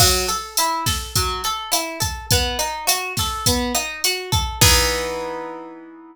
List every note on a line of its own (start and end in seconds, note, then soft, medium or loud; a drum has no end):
0.00 0.26 F#3 loud
0.00 kick medium
0.00 cross-stick medium
0.00 crash medium
0.28 0.54 A4 medium
0.28 closed hi-hat medium
0.57 0.84 E4 medium
0.57 closed hi-hat loud
0.86 1.12 A4 medium
0.86 kick medium
0.86 snare medium
0.86 closed hi-hat medium
1.16 1.42 F#3 medium
1.16 kick medium
1.16 closed hi-hat medium
1.44 1.71 A4 medium
1.44 closed hi-hat medium
1.72 1.98 E4 medium
1.72 cross-stick medium
1.72 closed hi-hat medium
2.00 2.26 A4 medium
2.00 kick medium
2.00 closed hi-hat medium
2.31 2.58 B3 loud
2.31 kick medium
2.31 closed hi-hat medium
2.59 2.85 D#4 medium
2.59 closed hi-hat medium
2.87 3.13 F#4 medium
2.87 cross-stick medium
2.87 closed hi-hat loud
3.17 3.45 A4 medium
3.17 kick medium
3.17 snare soft
3.17 closed hi-hat medium
3.46 3.73 B3 medium
3.46 kick medium
3.46 closed hi-hat medium
3.75 4.00 D#4 medium
3.75 cross-stick medium
3.75 closed hi-hat medium
4.04 4.31 F#4 medium
4.04 closed hi-hat medium
4.32 4.58 A4 medium
4.32 kick medium
4.32 closed hi-hat medium
4.61 6.16 E3 loud
4.61 6.16 B3 loud
4.61 6.16 D#4 loud
4.61 6.16 G#4 loud
4.61 kick loud
4.61 crash loud